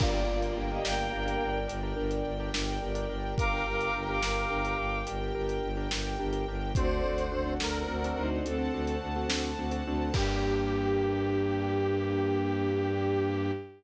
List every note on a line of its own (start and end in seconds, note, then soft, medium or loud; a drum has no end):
0.00 0.24 G1 medium
0.00 1.50 A#3 medium
0.00 0.11 D4 loud
0.00 0.13 F4 medium
0.00 0.11 G4 medium
0.00 0.11 A#4 loud
0.00 3.35 A#4 loud
0.00 0.13 D5 medium
0.00 3.35 D5 loud
0.00 3.35 G5 medium
0.00 kick loud
0.00 crash loud
0.13 0.25 D4 medium
0.13 0.27 F4 medium
0.13 0.25 G4 medium
0.13 0.25 A#4 medium
0.13 0.27 D5 medium
0.28 0.52 G1 medium
0.28 0.51 D4 medium
0.28 0.42 F4 medium
0.28 0.51 G4 medium
0.28 0.51 A#4 medium
0.28 0.42 D5 medium
0.42 0.56 F4 medium
0.42 0.56 D5 medium
0.42 closed hi-hat medium
0.56 0.80 G1 medium
0.56 0.69 D4 medium
0.56 0.69 G4 medium
0.56 0.69 A#4 medium
0.70 0.83 D4 medium
0.70 0.84 G4 medium
0.70 0.83 G4 medium
0.70 0.83 A#4 medium
0.70 0.84 D#5 medium
0.84 1.08 G1 medium
0.84 1.07 D4 medium
0.84 1.07 G4 medium
0.84 1.58 A#4 medium
0.84 1.07 A#4 medium
0.84 1.58 G5 medium
0.84 snare loud
1.12 1.36 G1 medium
1.12 1.23 D4 medium
1.12 1.23 G4 medium
1.12 1.23 A#4 medium
1.25 1.59 D4 loud
1.25 1.59 G4 medium
1.25 1.59 A#4 loud
1.25 closed hi-hat medium
1.42 1.65 G1 medium
1.68 1.93 G1 medium
1.68 1.79 D4 medium
1.68 1.79 G4 medium
1.68 1.79 A#4 medium
1.68 closed hi-hat medium
1.83 1.94 D4 medium
1.83 1.94 G4 medium
1.83 1.94 A#4 medium
1.97 2.22 G1 medium
1.97 2.30 D4 medium
1.97 2.30 G4 medium
1.97 2.30 A#4 medium
2.11 closed hi-hat medium
2.25 2.49 G1 medium
2.40 2.51 D4 medium
2.40 2.51 G4 loud
2.40 2.51 A#4 medium
2.54 2.78 G1 medium
2.54 2.77 D4 medium
2.54 2.77 G4 medium
2.54 2.77 A#4 medium
2.54 snare loud
2.82 3.06 G1 medium
2.82 2.93 D4 medium
2.82 2.93 G4 medium
2.82 2.93 A#4 medium
2.95 3.06 D4 medium
2.95 3.06 G4 medium
2.95 3.06 A#4 medium
2.95 closed hi-hat medium
3.09 3.33 G1 medium
3.09 3.43 D4 medium
3.09 3.43 G4 medium
3.09 3.43 A#4 medium
3.38 3.62 G1 medium
3.38 6.72 G4 loud
3.38 4.78 A#4 loud
3.38 6.72 A#4 medium
3.38 3.51 F5 medium
3.38 6.72 G5 loud
3.38 3.51 D6 medium
3.38 kick loud
3.38 closed hi-hat medium
3.52 3.64 D4 medium
3.52 3.64 G4 medium
3.52 3.64 A#4 medium
3.52 3.65 F5 medium
3.52 3.65 D6 medium
3.66 3.90 G1 medium
3.66 3.90 D4 medium
3.66 3.90 G4 medium
3.66 3.90 A#4 medium
3.66 3.80 F5 medium
3.66 3.80 D6 medium
3.80 3.94 F5 medium
3.80 3.94 D6 medium
3.80 closed hi-hat medium
3.94 4.19 G1 medium
3.94 4.06 D4 medium
3.94 4.06 G4 medium
3.94 4.06 A#4 medium
4.08 4.20 D4 medium
4.08 4.20 G4 medium
4.08 4.20 A#4 medium
4.08 4.22 F5 medium
4.08 4.22 D6 medium
4.22 4.46 G1 medium
4.22 4.44 D4 medium
4.22 4.44 G4 medium
4.22 4.44 A#4 medium
4.22 4.98 F5 medium
4.22 4.98 D6 medium
4.22 snare loud
4.50 4.74 G1 medium
4.50 4.62 D4 medium
4.50 4.62 G4 medium
4.50 4.62 A#4 medium
4.65 4.99 D4 medium
4.65 4.99 G4 medium
4.65 4.99 A#4 medium
4.65 closed hi-hat medium
4.78 5.02 G1 medium
5.07 5.31 G1 medium
5.07 5.18 D4 medium
5.07 5.18 G4 medium
5.07 5.18 A#4 medium
5.07 closed hi-hat medium
5.20 5.32 D4 medium
5.20 5.32 G4 medium
5.20 5.32 A#4 medium
5.35 5.59 G1 medium
5.35 5.69 D4 medium
5.35 5.69 G4 medium
5.35 5.69 A#4 medium
5.49 closed hi-hat medium
5.63 5.87 G1 medium
5.77 5.88 D4 medium
5.77 5.88 G4 medium
5.77 5.88 A#4 medium
5.91 6.16 G1 medium
5.91 6.15 D4 medium
5.91 6.15 G4 medium
5.91 6.15 A#4 medium
5.91 snare loud
6.20 6.44 G1 medium
6.20 6.31 D4 medium
6.20 6.31 G4 medium
6.20 6.31 A#4 medium
6.33 6.44 D4 medium
6.33 6.44 G4 medium
6.33 6.44 A#4 medium
6.33 closed hi-hat medium
6.48 6.72 G1 medium
6.48 6.71 D4 medium
6.48 6.71 G4 medium
6.48 6.71 A#4 medium
6.75 7.00 D2 loud
6.75 6.88 C4 loud
6.75 6.88 D4 loud
6.75 7.24 F#4 medium
6.75 6.88 F#4 loud
6.75 8.43 A4 medium
6.75 6.88 A4 medium
6.75 7.54 C5 loud
6.75 8.43 C5 medium
6.75 8.43 D5 medium
6.75 7.24 D5 medium
6.75 8.43 F#5 medium
6.75 kick loud
6.75 closed hi-hat loud
6.92 7.03 C4 medium
6.92 7.03 D4 medium
6.92 7.03 F#4 medium
6.92 7.03 A4 medium
7.03 7.29 D2 medium
7.03 7.26 C4 medium
7.03 7.26 D4 medium
7.03 7.26 F#4 medium
7.03 7.26 A4 medium
7.18 closed hi-hat medium
7.31 7.56 D2 medium
7.31 7.43 C4 medium
7.31 7.43 D4 medium
7.31 7.43 F#4 medium
7.31 7.43 A4 medium
7.46 7.57 C4 loud
7.46 7.57 D4 medium
7.46 7.57 F#4 medium
7.46 7.57 A4 medium
7.60 7.84 D2 medium
7.60 7.83 C4 medium
7.60 7.83 D4 medium
7.60 7.83 F#4 medium
7.60 7.83 A4 medium
7.60 8.30 A#4 medium
7.60 snare loud
7.88 8.12 D2 medium
7.88 8.00 C4 medium
7.88 8.00 D4 medium
7.88 8.00 F#4 medium
7.88 8.00 A4 medium
8.04 8.38 C4 medium
8.04 8.38 D4 medium
8.04 8.38 F#4 medium
8.04 8.38 A4 medium
8.04 closed hi-hat medium
8.17 8.41 D2 medium
8.17 8.44 D#4 medium
8.17 8.44 C5 medium
8.45 8.69 D2 medium
8.45 8.56 C4 medium
8.45 8.95 C4 medium
8.45 8.56 D4 medium
8.45 8.56 F#4 medium
8.45 8.56 A4 medium
8.45 8.95 A4 medium
8.45 10.14 A4 medium
8.45 10.14 C5 medium
8.45 10.14 F#5 medium
8.45 10.14 A5 medium
8.45 closed hi-hat medium
8.58 8.70 C4 medium
8.58 8.70 D4 medium
8.58 8.70 F#4 medium
8.58 8.70 A4 medium
8.73 8.97 D2 medium
8.73 9.08 C4 medium
8.73 9.08 D4 medium
8.73 9.08 F#4 medium
8.73 9.08 A4 medium
8.87 closed hi-hat medium
9.02 9.25 D2 medium
9.16 9.27 C4 medium
9.16 9.27 D4 medium
9.16 9.27 F#4 medium
9.16 9.27 A4 medium
9.29 9.54 D2 medium
9.29 9.51 C4 medium
9.29 9.51 D4 medium
9.29 9.51 F#4 medium
9.29 9.51 A4 medium
9.29 snare loud
9.58 9.81 D2 medium
9.58 9.70 C4 medium
9.58 9.70 D4 medium
9.58 9.70 F#4 medium
9.58 9.70 A4 medium
9.71 9.83 C4 medium
9.71 9.83 D4 medium
9.71 9.83 F#4 medium
9.71 9.83 A4 medium
9.71 closed hi-hat medium
9.86 10.10 D2 medium
9.86 10.10 C4 medium
9.86 10.10 D4 medium
9.86 10.10 F#4 medium
9.86 10.10 A4 medium
10.14 13.51 G2 loud
10.14 13.51 A#3 loud
10.14 13.51 D4 medium
10.14 13.51 D4 loud
10.14 13.51 G4 loud
10.14 13.51 A#4 loud
10.14 kick loud
10.14 crash loud